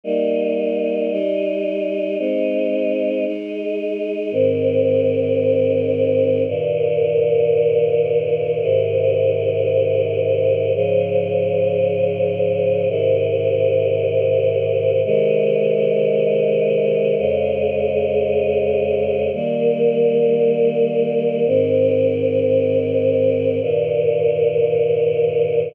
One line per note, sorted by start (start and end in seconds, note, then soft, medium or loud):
0.04 1.10 G3 medium
0.04 1.10 A#3 medium
0.04 1.10 D#4 medium
1.11 2.17 G3 medium
1.11 2.17 D#4 medium
1.11 2.17 G4 medium
2.19 3.25 G#3 medium
2.19 3.25 C4 medium
2.19 3.25 D#4 medium
3.25 4.31 G#3 medium
3.25 4.31 D#4 medium
3.25 4.31 G#4 medium
4.32 6.44 G#2 medium
4.32 6.44 D#3 medium
4.32 6.44 C4 medium
6.48 8.60 G2 medium
6.48 8.60 A#2 medium
6.48 8.60 D#3 medium
8.61 10.73 G#2 medium
8.61 10.73 C3 medium
8.61 10.73 D#3 medium
10.75 12.87 G#2 medium
10.75 12.87 C#3 medium
10.75 12.87 F3 medium
12.89 15.01 G#2 medium
12.89 15.01 C3 medium
12.89 15.01 D#3 medium
15.04 17.17 C3 medium
15.04 17.17 D#3 medium
15.04 17.17 G#3 medium
17.18 19.30 F2 medium
17.18 19.30 C#3 medium
17.18 19.30 G#3 medium
19.33 21.45 D#3 medium
19.33 21.45 G3 medium
19.33 21.45 A#3 medium
21.46 23.58 G#2 medium
21.46 23.58 D#3 medium
21.46 23.58 C4 medium
23.60 25.73 G2 medium
23.60 25.73 A#2 medium
23.60 25.73 D#3 medium